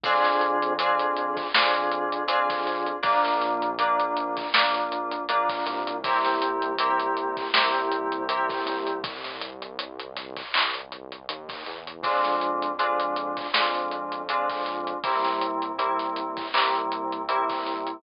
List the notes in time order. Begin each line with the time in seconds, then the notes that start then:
0.04 F2 C4 D4 F4 G#4, kick, closed hi-hat
0.24 snare, closed hi-hat
0.41 closed hi-hat
0.62 closed hi-hat
0.79 C4 D4 F4 G#4, closed hi-hat
0.99 closed hi-hat
1.17 closed hi-hat
1.37 kick, closed hi-hat
1.54 F2 C4 D4 F4 G#4, snare
1.75 closed hi-hat
1.92 closed hi-hat
2.12 closed hi-hat
2.27 C4 D4 F4 G#4, closed hi-hat
2.50 kick, closed hi-hat
2.67 closed hi-hat
2.86 closed hi-hat
3.03 A#1 A#3 D4 F4, kick, closed hi-hat
3.25 snare, closed hi-hat
3.42 snare, closed hi-hat
3.62 closed hi-hat
3.79 A#3 D4 F4, closed hi-hat
4.00 closed hi-hat
4.17 closed hi-hat
4.37 kick, closed hi-hat
4.54 A#1 A#3 D4 F4, snare
4.74 closed hi-hat
4.92 closed hi-hat
5.11 closed hi-hat
5.29 A#1 A#3 D4 F4, closed hi-hat
5.49 kick, closed hi-hat
5.66 C2, closed hi-hat
5.87 closed hi-hat
6.04 A#3 C4 E4 G4, kick, closed hi-hat
6.25 snare, closed hi-hat
6.42 closed hi-hat
6.62 closed hi-hat
6.78 A#3 C4 E4 G4, closed hi-hat
7.00 closed hi-hat
7.17 closed hi-hat
7.37 kick, closed hi-hat
7.54 C2 A#3 C4 E4 G4, snare
7.74 closed hi-hat
7.92 closed hi-hat
8.12 closed hi-hat
8.29 A#3 C4 E4 G4, closed hi-hat
8.49 kick, closed hi-hat
8.66 C2, closed hi-hat
8.87 closed hi-hat
9.04 kick, closed hi-hat
9.24 snare, closed hi-hat
9.41 closed hi-hat
9.62 closed hi-hat
9.79 closed hi-hat
10.00 closed hi-hat
10.16 snare, closed hi-hat
10.37 kick, snare, closed hi-hat
10.54 C2, clap
10.74 closed hi-hat
10.92 closed hi-hat
11.12 closed hi-hat
11.29 D#2, closed hi-hat
11.49 kick, closed hi-hat
11.66 E2, closed hi-hat
11.87 closed hi-hat
12.03 F2 G#3 C4 D4 F4, kick, closed hi-hat
12.24 snare, closed hi-hat
12.41 closed hi-hat
12.62 closed hi-hat
12.79 G#3 C4 D4 F4, closed hi-hat
13.00 closed hi-hat
13.16 closed hi-hat
13.37 kick, closed hi-hat
13.53 F2 G#3 C4 D4 F4, snare
13.74 closed hi-hat
13.91 closed hi-hat
14.12 closed hi-hat
14.29 G#3 C4 D4 F4, closed hi-hat
14.49 kick, closed hi-hat
14.66 closed hi-hat
14.87 closed hi-hat
15.04 C2 G3 A#3 C4 E4, kick, closed hi-hat
15.25 snare, closed hi-hat
15.41 closed hi-hat
15.62 closed hi-hat
15.78 G3 A#3 C4 E4, closed hi-hat
15.99 snare, closed hi-hat
16.16 closed hi-hat
16.37 kick, closed hi-hat
16.54 C2 G3 A#3 C4 E4, clap
16.75 closed hi-hat
16.92 closed hi-hat
17.12 closed hi-hat
17.28 G3 A#3 C4 E4, closed hi-hat
17.50 kick, closed hi-hat
17.67 closed hi-hat
17.87 closed hi-hat